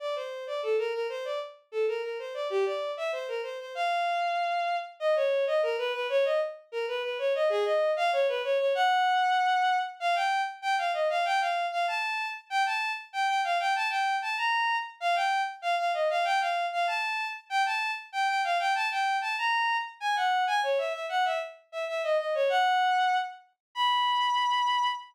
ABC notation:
X:1
M:2/2
L:1/8
Q:1/2=96
K:Bb
V:1 name="Violin"
d c2 d A B B c | d z2 A B B c d | G d2 =e c B c c | f7 z |
[K:B] d c2 d A B B c | d z2 A B B c d | G d2 =f c B c c | f7 z |
[K:Bb] f g2 z g f e f | g f2 f a3 z | g a2 z g g f g | a g2 a b3 z |
f g2 z f f e f | g f2 f a3 z | g a2 z g g f g | a g2 a b3 z |
[K:B] g f2 g c e e f | e z2 e e d d c | f5 z3 | b8 |]